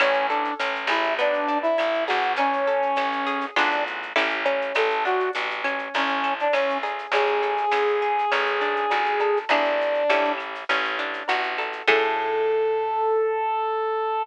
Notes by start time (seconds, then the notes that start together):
0.00 A1 C#4, cowbell, claves, shaker
0.14 shaker
0.29 D4 A4, shaker
0.45 shaker
0.59 A1 C#4, tambourine, shaker
0.75 shaker
0.87 A1 E4 G#4, claves, shaker
1.03 shaker
1.19 B3 D4, cowbell, shaker
1.33 shaker
1.48 D4, shaker
1.62 E4, shaker
1.78 A1 E4, tambourine, cowbell, claves, shaker
1.94 shaker
2.07 A1 F#4 G#4, cowbell, shaker
2.23 shaker
2.36 C#4, cowbell, shaker
2.53 shaker
2.67 A4, shaker
2.82 shaker
2.96 A1 C#4, tambourine, claves, shaker
3.12 shaker
3.27 G#4, shaker
3.41 shaker
3.56 A1 B3 D4 F4 G#4, cowbell, claves, shaker
3.71 shaker
3.87 shaker
4.02 shaker
4.16 A1 C#4 E4 G4 A4, tambourine, cowbell, shaker
4.29 shaker
4.45 C#4, cowbell, shaker
4.61 shaker
4.74 A1 A4, cowbell, claves, shaker
4.90 shaker
5.05 D4 F#4, shaker
5.20 shaker
5.33 A1 F#4, tambourine, shaker
5.50 shaker
5.64 C#4, claves, shaker
5.79 shaker
5.94 A1 C#4, cowbell, shaker
6.08 shaker
6.24 A4, shaker
6.39 D4, shaker
6.53 A1 C#4, tambourine, cowbell, claves, shaker
6.70 shaker
6.83 G#4, cowbell, shaker
6.99 shaker
7.12 A1 C#4 G#4, cowbell, shaker
7.26 shaker
7.43 A4, shaker
7.57 shaker
7.71 A1 C#4, tambourine, claves, shaker
7.88 shaker
8.02 G#4, shaker
8.19 shaker
8.32 A1 C#4, cowbell, claves, shaker
8.46 shaker
8.61 D4, shaker
8.76 shaker
8.90 A1 F#4, tambourine, cowbell, shaker
9.05 shaker
9.19 A4, cowbell, shaker
9.37 shaker
9.49 A1 B3 D4 E4 G#4, cowbell, claves, shaker
9.64 shaker
9.81 shaker
9.94 shaker
10.10 A1 C#4 E4 G4 A4, tambourine, shaker
10.25 shaker
10.38 claves, shaker
10.55 shaker
10.69 A1 C#4, cowbell, shaker
10.84 shaker
10.99 D4, shaker
11.13 shaker
11.28 A1 F#4, tambourine, cowbell, claves, shaker
11.43 shaker
11.58 A4, cowbell, shaker
11.73 shaker
11.87 A2 C#4 E4 G#4 A4, kick, crash